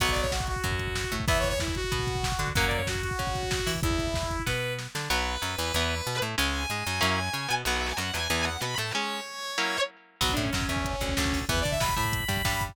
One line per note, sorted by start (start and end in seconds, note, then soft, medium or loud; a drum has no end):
0.00 0.55 B1 medium
0.00 0.27 F#3 loud
0.00 0.27 B3 medium
0.00 0.10 F#5 medium
0.00 kick medium
0.00 closed hi-hat medium
0.09 0.21 D5 medium
0.09 kick medium
0.16 kick medium
0.16 closed hi-hat medium
0.21 0.31 C#5 medium
0.21 kick medium
0.31 0.46 F#4 medium
0.31 kick medium
0.31 snare medium
0.40 kick medium
0.47 1.14 F#4 medium
0.47 kick medium
0.47 closed hi-hat medium
0.56 kick medium
0.64 1.05 F#2 medium
0.64 1.05 F#3 medium
0.64 kick medium
0.64 closed hi-hat medium
0.71 kick medium
0.79 kick medium
0.79 closed hi-hat medium
0.87 kick medium
0.95 kick medium
0.95 snare medium
1.04 kick medium
1.12 1.25 A2 medium
1.12 1.25 A3 medium
1.12 kick medium
1.12 closed hi-hat medium
1.20 kick medium
1.28 1.82 E2 medium
1.28 1.54 E3 medium
1.28 1.54 B3 medium
1.28 1.38 E5 medium
1.28 kick loud
1.28 closed hi-hat medium
1.36 1.48 C#5 medium
1.36 kick medium
1.44 kick medium
1.44 closed hi-hat medium
1.49 1.59 C#5 medium
1.49 kick medium
1.60 1.74 E4 medium
1.60 kick medium
1.60 snare medium
1.68 kick medium
1.75 2.49 F#4 medium
1.75 kick medium
1.75 closed hi-hat medium
1.84 kick medium
1.92 2.33 B2 medium
1.92 2.32 B3 medium
1.92 kick medium
1.92 closed hi-hat medium
1.99 kick medium
2.07 kick medium
2.07 closed hi-hat medium
2.15 kick medium
2.23 kick medium
2.23 snare medium
2.32 kick medium
2.39 2.52 D3 medium
2.39 2.53 D4 medium
2.39 kick medium
2.39 closed hi-hat medium
2.47 kick medium
2.55 3.10 F#2 medium
2.55 2.82 F#3 medium
2.55 2.82 A#3 loud
2.55 2.82 C#4 medium
2.55 2.65 F#5 medium
2.55 kick medium
2.55 closed hi-hat medium
2.63 2.77 D5 medium
2.63 kick medium
2.71 kick medium
2.71 closed hi-hat medium
2.76 2.87 C#5 medium
2.76 kick medium
2.87 3.02 F#4 medium
2.87 kick medium
2.87 snare medium
2.95 kick medium
3.02 3.71 F#4 medium
3.02 kick medium
3.02 closed hi-hat medium
3.11 kick medium
3.19 3.60 C#3 medium
3.19 3.59 C#4 medium
3.19 kick medium
3.19 closed hi-hat medium
3.27 kick medium
3.35 kick medium
3.35 closed hi-hat medium
3.43 kick medium
3.51 kick medium
3.51 snare medium
3.59 kick medium
3.66 3.81 E3 medium
3.66 3.80 E4 medium
3.66 kick medium
3.66 open hi-hat medium
3.75 kick medium
3.83 4.37 E2 medium
3.83 4.42 E4 medium
3.83 kick loud
3.83 closed hi-hat medium
3.91 kick medium
3.99 kick medium
3.99 closed hi-hat medium
4.07 kick medium
4.14 kick medium
4.14 snare medium
4.23 kick medium
4.31 kick medium
4.31 closed hi-hat medium
4.39 kick medium
4.46 4.88 B2 medium
4.46 4.87 B3 medium
4.46 4.73 B4 medium
4.46 kick medium
4.46 snare medium
4.79 snare medium
4.95 5.08 D3 medium
4.95 5.09 D4 medium
4.95 snare medium
5.10 5.37 B1 medium
5.10 5.36 F#3 loud
5.10 5.36 B3 medium
5.10 6.15 B4 loud
5.42 5.56 F#2 medium
5.42 5.55 F#3 medium
5.58 5.72 E2 medium
5.58 5.72 E3 medium
5.74 6.01 E2 medium
5.74 5.95 E3 medium
5.74 5.95 B3 medium
6.07 6.20 B2 medium
6.07 6.20 B3 medium
6.22 6.35 A2 medium
6.22 6.36 A3 medium
6.38 6.66 C#2 medium
6.38 6.63 G#3 loud
6.38 6.63 C#4 medium
6.38 7.49 G#5 medium
6.70 6.83 G#2 medium
6.70 6.85 G#3 medium
6.87 7.00 F#2 medium
6.87 7.00 F#3 medium
7.01 7.29 F#2 medium
7.01 7.20 F#3 medium
7.01 7.20 A#3 medium
7.01 7.20 C#4 medium
7.01 7.20 E4 loud
7.33 7.47 C#3 medium
7.33 7.47 C#4 medium
7.48 7.64 B2 medium
7.48 7.62 B3 medium
7.65 7.93 B1 medium
7.65 7.93 F#3 medium
7.65 7.93 B3 medium
7.65 7.75 F#5 loud
7.76 7.86 E5 medium
7.87 7.97 G#5 medium
7.97 8.12 F#2 medium
7.97 8.10 F#3 medium
7.97 8.13 F#5 medium
8.14 8.28 E2 medium
8.14 8.27 E3 medium
8.14 8.41 G#5 medium
8.30 8.57 E2 medium
8.30 8.49 E3 medium
8.30 8.49 B3 medium
8.45 8.61 F#5 medium
8.61 8.75 B2 medium
8.61 8.76 B3 medium
8.61 8.74 B5 medium
8.78 8.92 A2 medium
8.78 8.92 A3 medium
8.78 8.91 A5 medium
8.93 9.20 G#3 medium
8.93 9.20 C#4 loud
8.93 9.77 C#5 medium
9.58 9.77 F#3 medium
9.58 9.77 A#3 medium
9.58 9.77 C#4 medium
9.58 9.77 E4 medium
10.21 10.35 B1 medium
10.21 10.35 F#3 medium
10.21 10.35 B3 medium
10.21 10.31 F#4 medium
10.21 kick medium
10.21 crash medium
10.29 10.42 D4 medium
10.29 kick medium
10.37 10.50 A2 medium
10.37 10.50 A3 medium
10.37 kick medium
10.37 closed hi-hat medium
10.42 10.52 C#4 medium
10.42 kick medium
10.53 10.66 F#2 medium
10.53 10.68 F#3 medium
10.53 10.69 C#4 medium
10.53 kick medium
10.53 snare medium
10.61 kick medium
10.68 10.96 E2 medium
10.68 10.96 E3 medium
10.68 11.38 C#4 medium
10.68 kick medium
10.68 closed hi-hat medium
10.76 kick medium
10.85 kick medium
10.85 closed hi-hat medium
10.93 kick medium
11.01 11.15 D2 medium
11.01 11.14 D3 medium
11.01 kick medium
11.01 closed hi-hat medium
11.09 kick medium
11.17 11.45 D2 medium
11.17 11.46 D3 medium
11.17 kick medium
11.17 snare medium
11.25 kick medium
11.33 kick medium
11.33 open hi-hat medium
11.41 kick medium
11.49 11.63 E2 medium
11.49 11.63 E3 medium
11.49 11.63 B3 medium
11.49 11.59 B4 medium
11.49 kick medium
11.49 closed hi-hat medium
11.57 kick medium
11.61 11.78 D4 medium
11.61 11.71 D5 medium
11.65 11.79 D3 medium
11.65 kick medium
11.65 closed hi-hat medium
11.71 11.81 E5 medium
11.71 kick medium
11.80 11.94 B2 medium
11.80 11.95 B3 medium
11.80 11.95 B5 medium
11.80 kick medium
11.80 snare medium
11.89 kick medium
11.96 12.25 A2 medium
11.96 12.24 A3 medium
11.96 12.63 B5 medium
11.96 kick medium
11.96 closed hi-hat medium
12.05 kick medium
12.13 kick medium
12.13 closed hi-hat medium
12.20 kick medium
12.28 12.42 G2 medium
12.28 12.42 G3 medium
12.28 kick medium
12.28 closed hi-hat medium
12.37 kick medium
12.45 12.72 G2 medium
12.45 12.72 G3 medium
12.45 kick medium
12.45 snare medium
12.53 kick medium
12.61 kick medium
12.61 closed hi-hat medium
12.69 kick medium